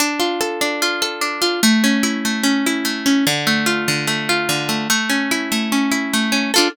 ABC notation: X:1
M:4/4
L:1/8
Q:1/4=147
K:Ddor
V:1 name="Acoustic Guitar (steel)"
D F A D F A D F | A, ^C E A, C E A, C | D, A, F D, A, F D, A, | A, ^C E A, C E A, C |
[DFA]2 z6 |]